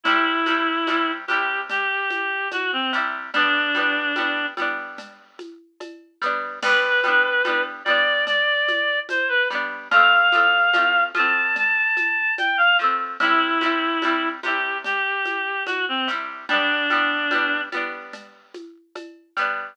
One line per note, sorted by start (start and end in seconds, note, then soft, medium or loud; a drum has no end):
0.04 0.43 C3 medium
0.04 0.43 G3 medium
0.04 1.11 E4 medium
0.04 cowbell medium
0.04 low conga medium
0.04 shaker medium
0.10 0.43 E4 medium
0.46 0.84 C3 medium
0.46 0.84 G3 medium
0.46 high conga medium
0.46 shaker medium
0.51 0.84 E4 medium
0.87 1.25 C3 medium
0.87 1.25 G3 medium
0.87 cowbell medium
0.87 high conga medium
0.87 shaker medium
0.92 1.25 E4 medium
1.27 2.80 C3 medium
1.27 2.80 G3 medium
1.27 1.61 G4 medium
1.27 high conga medium
1.27 shaker medium
1.33 2.80 E4 medium
1.70 2.48 G4 medium
1.70 cowbell medium
1.70 low conga medium
1.70 shaker medium
2.11 high conga medium
2.11 shaker medium
2.51 2.71 F#4 medium
2.51 cowbell medium
2.51 high conga medium
2.51 shaker medium
2.72 2.92 C4 medium
2.93 3.31 C3 medium
2.93 3.31 G3 medium
2.93 shaker medium
2.97 3.31 E4 medium
3.34 3.72 G3 medium
3.34 3.72 B3 medium
3.34 4.46 D4 medium
3.34 cowbell medium
3.34 low conga medium
3.34 shaker medium
3.39 3.72 D4 medium
3.75 4.13 G3 medium
3.75 4.13 B3 medium
3.75 high conga medium
3.75 shaker medium
3.79 4.13 D4 medium
4.16 4.54 G3 medium
4.16 4.54 B3 medium
4.16 cowbell medium
4.16 high conga medium
4.16 shaker medium
4.21 4.54 D4 medium
4.57 6.08 G3 medium
4.57 6.08 B3 medium
4.57 high conga medium
4.57 shaker medium
4.62 6.08 D4 medium
4.98 cowbell medium
4.98 low conga medium
4.98 shaker medium
5.39 high conga medium
5.39 shaker medium
5.80 cowbell medium
5.80 high conga medium
5.80 shaker medium
6.22 6.59 G3 medium
6.22 6.59 B3 medium
6.22 shaker medium
6.26 6.59 D4 medium
6.63 7.01 G3 medium
6.63 7.01 B3 medium
6.63 7.63 B4 medium
6.63 crash loud
6.63 cowbell medium
6.63 low conga medium
6.63 shaker medium
6.67 7.01 D4 medium
7.04 7.42 G3 medium
7.04 7.42 B3 medium
7.04 high conga medium
7.04 shaker medium
7.08 7.42 D4 medium
7.45 7.83 G3 medium
7.45 7.83 B3 medium
7.45 cowbell medium
7.45 high conga medium
7.45 shaker medium
7.49 7.83 D4 medium
7.85 9.37 G3 medium
7.85 9.37 B3 medium
7.85 8.25 D5 medium
7.85 high conga medium
7.85 shaker medium
7.90 9.37 D4 medium
8.27 8.99 D5 medium
8.27 cowbell medium
8.27 low conga medium
8.27 shaker medium
8.68 high conga medium
8.68 shaker medium
9.09 9.29 C5 medium
9.09 cowbell medium
9.09 high conga medium
9.09 shaker medium
9.29 9.48 B4 medium
9.50 9.88 G3 medium
9.50 9.88 B3 medium
9.50 shaker medium
9.55 9.88 D4 medium
9.91 10.29 F3 medium
9.91 10.29 A3 loud
9.91 11.04 F5 medium
9.91 cowbell medium
9.91 low conga medium
9.91 shaker medium
9.96 10.29 C4 medium
10.32 10.70 F3 medium
10.32 10.70 A3 medium
10.32 high conga medium
10.32 shaker medium
10.37 10.70 C4 medium
10.73 11.11 F3 medium
10.73 11.11 A3 medium
10.73 cowbell medium
10.73 high conga medium
10.73 shaker medium
10.78 11.11 C4 medium
11.15 12.66 F3 medium
11.15 12.66 A3 medium
11.15 11.57 A5 medium
11.15 high conga medium
11.15 shaker medium
11.19 12.66 C4 medium
11.56 12.34 A5 medium
11.56 cowbell medium
11.56 low conga medium
11.56 shaker medium
11.97 high conga medium
11.97 shaker medium
12.38 12.57 G5 medium
12.38 cowbell medium
12.38 high conga medium
12.38 shaker medium
12.57 12.77 F5 medium
12.79 13.17 F3 medium
12.79 13.17 A3 medium
12.79 shaker soft
12.84 13.17 C4 medium
13.20 13.58 C3 medium
13.20 13.58 G3 medium
13.20 14.29 E4 medium
13.20 cowbell medium
13.20 low conga medium
13.20 shaker medium
13.25 13.58 E4 medium
13.61 13.99 C3 medium
13.61 13.99 G3 medium
13.61 high conga medium
13.61 shaker medium
13.66 13.99 E4 medium
14.02 14.40 C3 medium
14.02 14.40 G3 medium
14.02 cowbell medium
14.02 high conga medium
14.02 shaker medium
14.07 14.40 E4 medium
14.43 15.95 C3 medium
14.43 15.95 G3 medium
14.43 14.78 G4 medium
14.43 high conga medium
14.43 shaker medium
14.48 15.95 E4 medium
14.84 15.63 G4 medium
14.84 cowbell medium
14.84 low conga medium
14.84 shaker medium
15.26 high conga medium
15.26 shaker medium
15.66 15.85 F#4 medium
15.66 cowbell medium
15.66 high conga medium
15.66 shaker medium
15.88 16.08 C4 medium
16.08 16.46 C3 medium
16.08 16.46 G3 medium
16.08 shaker medium
16.12 16.46 E4 medium
16.49 16.87 G3 medium
16.49 16.87 B3 medium
16.49 17.61 D4 medium
16.49 cowbell medium
16.49 low conga medium
16.49 shaker medium
16.54 16.87 D4 medium
16.90 17.28 G3 medium
16.90 17.28 B3 medium
16.90 high conga medium
16.90 shaker medium
16.95 17.28 D4 medium
17.31 17.69 G3 medium
17.31 17.69 B3 medium
17.31 cowbell medium
17.31 high conga medium
17.31 shaker medium
17.36 17.69 D4 medium
17.72 19.23 G3 medium
17.72 19.23 B3 medium
17.72 high conga medium
17.72 shaker medium
17.77 19.23 D4 medium
18.13 cowbell medium
18.13 low conga medium
18.13 shaker medium
18.54 high conga medium
18.54 shaker medium
18.96 cowbell medium
18.96 high conga medium
18.96 shaker medium
19.37 19.74 G3 medium
19.37 19.74 B3 medium
19.37 shaker medium
19.41 19.74 D4 medium